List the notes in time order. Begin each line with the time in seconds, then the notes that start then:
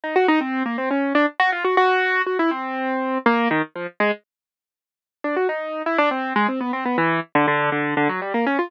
0.04 D#4
0.16 F#4
0.28 D#4
0.41 C4
0.66 A#3
0.78 C4
0.91 C#4
1.15 D4
1.40 F#4
1.52 F4
1.65 F#4
1.77 F#4
2.27 F#4
2.39 E4
2.51 C4
3.26 A#3
3.51 D#3
3.76 F3
4.00 G#3
5.24 D4
5.36 F#4
5.49 D#4
5.86 E4
5.98 D4
6.11 C4
6.36 G#3
6.48 C4
6.61 B3
6.73 C4
6.85 B3
6.98 E3
7.35 D3
7.48 D3
7.72 D3
7.97 D3
8.09 F#3
8.22 G3
8.34 A#3
8.46 C#4
8.59 F4